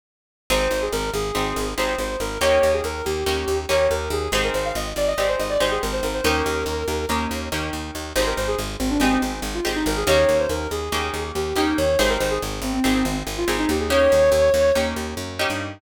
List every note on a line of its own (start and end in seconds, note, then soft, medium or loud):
0.50 0.68 G#1 medium
0.50 1.28 C4 medium
0.50 1.28 D#4 medium
0.50 1.28 G4 medium
0.50 1.28 G#4 medium
0.50 0.78 C5 medium
0.71 0.89 G#1 medium
0.82 0.92 G#4 medium
0.92 1.11 G#1 medium
0.92 1.10 A#4 medium
1.14 1.32 G#1 medium
1.14 1.69 G#4 medium
1.35 1.53 G#1 medium
1.35 1.74 C4 medium
1.35 1.74 D#4 medium
1.35 1.74 G4 medium
1.35 1.74 G#4 medium
1.56 1.74 G#1 medium
1.77 1.96 G#1 medium
1.77 2.36 C4 medium
1.77 2.36 D#4 medium
1.77 2.36 G4 medium
1.77 2.36 G#4 medium
1.77 1.95 C5 medium
1.98 2.17 G#1 medium
1.98 2.17 C5 medium
2.20 2.38 G#1 medium
2.20 2.39 A#4 medium
2.41 2.59 D#2 medium
2.41 3.20 A#3 medium
2.41 3.20 C#4 medium
2.41 3.20 D#4 medium
2.41 3.20 G4 medium
2.41 2.71 C#5 medium
2.63 2.81 D#2 medium
2.73 2.84 G#4 medium
2.84 3.02 D#2 medium
2.84 3.04 A#4 medium
3.05 3.24 D#2 medium
3.05 3.58 G4 medium
3.26 3.45 D#2 medium
3.26 3.66 A#3 medium
3.26 3.66 C#4 medium
3.26 3.66 D#4 medium
3.26 3.66 G4 medium
3.48 3.66 D#2 medium
3.69 3.88 D#2 medium
3.69 4.28 A#3 medium
3.69 4.28 C#4 medium
3.69 4.28 D#4 medium
3.69 4.28 G4 medium
3.69 3.87 C#5 medium
3.90 4.09 D#2 medium
3.90 4.10 A#4 medium
4.10 4.28 D#2 medium
4.10 4.30 G#4 medium
4.32 4.50 G#1 medium
4.32 5.11 C4 medium
4.32 5.11 D#4 medium
4.32 5.11 G4 medium
4.32 5.11 G#4 medium
4.32 4.43 C5 medium
4.44 4.54 A#4 medium
4.54 4.72 G#1 medium
4.54 4.64 C5 medium
4.65 4.75 F5 medium
4.75 4.93 G#1 medium
4.75 4.86 D#5 medium
4.96 5.14 G#1 medium
4.96 5.07 D5 medium
5.07 5.17 D#5 medium
5.18 5.36 G#1 medium
5.18 5.57 C4 medium
5.18 5.57 D#4 medium
5.18 5.57 G4 medium
5.18 5.57 G#4 medium
5.18 5.28 D5 medium
5.29 5.39 C5 medium
5.39 5.58 G#1 medium
5.39 5.49 D#5 medium
5.50 5.60 D5 medium
5.60 5.79 G#1 medium
5.60 6.19 C4 medium
5.60 6.19 D#4 medium
5.60 6.19 G4 medium
5.60 6.19 G#4 medium
5.60 5.71 C5 medium
5.71 5.81 G#4 medium
5.82 6.01 G#1 medium
5.82 5.92 A#4 medium
5.93 6.03 C5 medium
6.03 6.21 G#1 medium
6.03 6.13 A#4 medium
6.14 6.24 C5 medium
6.24 6.42 D#2 medium
6.24 7.03 A#3 medium
6.24 7.03 C#4 medium
6.24 7.03 D#4 medium
6.24 7.03 G4 medium
6.24 7.05 A#4 medium
6.46 6.64 D#2 medium
6.66 6.84 D#2 medium
6.88 7.06 D#2 medium
7.09 7.27 D#2 medium
7.09 7.49 A#3 medium
7.09 7.49 C#4 medium
7.09 7.49 D#4 medium
7.09 7.49 G4 medium
7.31 7.49 D#2 medium
7.52 7.70 D#2 medium
7.52 8.11 A#3 medium
7.52 8.11 C#4 medium
7.52 8.11 D#4 medium
7.52 8.11 G4 medium
7.73 7.91 D#2 medium
7.95 8.13 D#2 medium
8.16 8.34 G#1 medium
8.16 8.94 C4 medium
8.16 8.94 D#4 medium
8.16 8.94 G4 medium
8.16 8.94 G#4 medium
8.16 8.26 C5 medium
8.26 8.37 A#4 medium
8.37 8.55 G#1 medium
8.37 8.47 C5 medium
8.48 8.58 G#4 medium
8.59 8.77 G#1 medium
8.80 8.98 G#1 medium
8.80 8.90 C4 medium
8.90 9.00 D4 medium
9.00 9.18 G#1 medium
9.00 9.60 C4 medium
9.00 9.11 C4 medium
9.00 9.60 D#4 medium
9.00 9.60 G4 medium
9.00 9.60 G#4 medium
9.12 9.22 C4 medium
9.22 9.40 G#1 medium
9.22 9.32 C4 medium
9.42 9.60 G#1 medium
9.54 9.64 F4 medium
9.65 9.84 G#1 medium
9.65 10.04 C4 medium
9.65 10.04 D#4 medium
9.65 10.04 G4 medium
9.65 10.04 G#4 medium
9.76 9.86 D#4 medium
9.86 10.04 G#1 medium
9.86 9.96 A#4 medium
9.97 10.07 G#4 medium
10.07 10.25 D#2 medium
10.07 10.86 A#3 medium
10.07 10.86 C#4 medium
10.07 10.86 D#4 medium
10.07 10.86 G4 medium
10.07 10.37 C#5 medium
10.29 10.47 D#2 medium
10.39 10.50 C5 medium
10.49 10.68 D#2 medium
10.49 10.69 A#4 medium
10.71 10.89 D#2 medium
10.71 11.22 G#4 medium
10.92 11.10 D#2 medium
10.92 11.51 A#3 medium
10.92 11.51 C#4 medium
10.92 11.51 D#4 medium
10.92 11.51 G4 medium
11.14 11.32 D#2 medium
11.35 11.53 D#2 medium
11.35 11.56 G4 medium
11.56 11.74 D#2 medium
11.56 11.95 A#3 medium
11.56 11.95 C#4 medium
11.56 11.77 D#4 medium
11.56 11.95 D#4 medium
11.56 11.95 G4 medium
11.77 11.96 D#2 medium
11.77 11.98 C#5 medium
11.99 12.18 G#1 medium
11.99 12.77 C4 medium
11.99 12.77 D#4 medium
11.99 12.77 G4 medium
11.99 12.77 G#4 medium
11.99 12.09 C5 medium
12.09 12.19 A#4 medium
12.20 12.39 G#1 medium
12.20 12.30 C5 medium
12.31 12.41 G#4 medium
12.42 12.60 G#1 medium
12.62 12.80 G#1 medium
12.62 12.73 C4 medium
12.73 12.83 C4 medium
12.84 13.03 G#1 medium
12.84 12.94 C4 medium
12.84 13.43 C4 medium
12.84 13.43 D#4 medium
12.84 13.43 G4 medium
12.84 13.43 G#4 medium
12.95 13.05 C4 medium
13.05 13.23 G#1 medium
13.05 13.15 C4 medium
13.27 13.45 G#1 medium
13.37 13.47 F4 medium
13.48 13.66 G#1 medium
13.48 13.87 C4 medium
13.48 13.87 D#4 medium
13.48 13.87 G4 medium
13.48 13.87 G#4 medium
13.59 13.69 D#4 medium
13.69 14.08 D#2 medium
13.69 13.79 G4 medium
13.80 13.90 G#4 medium
13.90 14.69 A#3 medium
13.90 14.69 C#4 medium
13.90 14.69 D#4 medium
13.90 14.69 G4 medium
13.90 14.72 C#5 medium
14.12 14.30 D#2 medium
14.32 14.50 D#2 medium
14.54 14.72 D#2 medium
14.75 14.94 D#2 medium
14.75 15.34 A#3 medium
14.75 15.34 C#4 medium
14.75 15.34 D#4 medium
14.75 15.34 G4 medium
14.96 15.14 D#2 medium
15.17 15.46 F#2 medium
15.39 15.79 A#3 medium
15.39 15.79 C#4 medium
15.39 15.79 D#4 medium
15.39 15.79 G4 medium
15.50 15.79 G2 medium